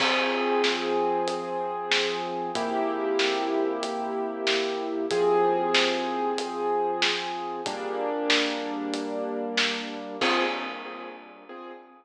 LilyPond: <<
  \new Staff \with { instrumentName = "Acoustic Grand Piano" } { \time 4/4 \key f \dorian \tempo 4 = 94 <f c' aes'>1 | <c bes e' g'>1 | <f c' aes'>1 | <g bes d'>1 |
<f c' aes'>4 r2. | }
  \new DrumStaff \with { instrumentName = "Drums" } \drummode { \time 4/4 <cymc bd>4 sn4 hh4 sn4 | <hh bd>4 sn4 hh4 sn4 | <hh bd>4 sn4 hh4 sn4 | <hh bd>4 sn4 hh4 sn4 |
<cymc bd>4 r4 r4 r4 | }
>>